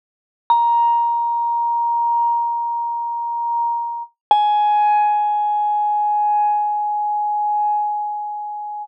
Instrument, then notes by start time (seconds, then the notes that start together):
vibraphone
0.50 A#5
4.31 G#5